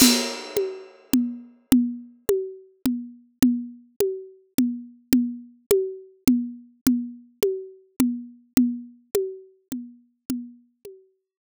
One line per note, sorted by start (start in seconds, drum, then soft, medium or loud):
0.00 crash loud
0.00 low conga loud
0.57 high conga medium
1.13 low conga medium
1.72 low conga loud
2.29 high conga medium
2.86 low conga medium
3.42 low conga loud
4.00 high conga medium
4.58 low conga medium
5.13 low conga medium
5.71 high conga medium
6.28 low conga loud
6.87 low conga medium
7.43 high conga medium
8.00 low conga medium
8.57 low conga loud
9.15 high conga medium
9.72 low conga medium
10.30 low conga loud
10.85 high conga medium